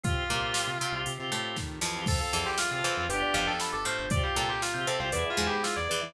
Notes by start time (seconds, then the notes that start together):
0.03 C2 C4 F4 G4, kick, closed hi-hat
0.09 G4
0.29 C2 A#2 A#3 C4 F4
0.35 G4
0.54 snare
0.67 C3
0.81 C3 C4
0.92 C2 C4 F4
0.98 G4
1.06 C3, closed hi-hat
1.18 C3 C4 F4
1.23 G4
1.32 A2 A3
1.56 D#3, kick, snare
1.81 F2 E3 F3, snare
1.96 C4 F4
2.01 G4
2.06 F2 C4 F4 A4 C5, kick, crash
2.10 F4 A4
2.20 A4 F5
2.33 E2 F2 E3 A5
2.46 G4 C6
2.58 F4 F6, snare
2.71 C3 C4 F4 A6
2.75 F4 A4
2.84 E2 E3 C5
2.97 F2 C4 F4 F5
3.02 A4
3.08 G1 B3 D4 F4 G4 B4, closed hi-hat
3.13 D4 F4
3.19 G4 D5
3.34 G1 F2 F3 G4 F5
3.47 A4 G5
3.60 B5, snare
3.72 G1 A4 D6
3.85 A2 A3 C5 F6
3.99 G1 G6
4.10 C2 C4 F4 G4 C5 D5, kick, closed hi-hat
4.16 G4
4.23 G4 F5
4.36 C2 A#2 A#3 A4 G5
4.49 G4 C6
4.62 F4 F6, snare
4.74 C3 C4 F4 G6
4.80 G4
4.87 C3 C4 A4 C5
4.99 C2 C4 F4 C5 F5
5.05 G4
5.12 E2 B3 E4 G#4 B4 D5, closed hi-hat
5.18 G#4
5.25 E5
5.30 F4
5.37 E2 G#2 G#3 G#5
5.47 G4 B5
5.63 F4 E6, snare
5.76 E2 D5 G#6
5.89 E2 E3 B4 D5
6.01 E3 E5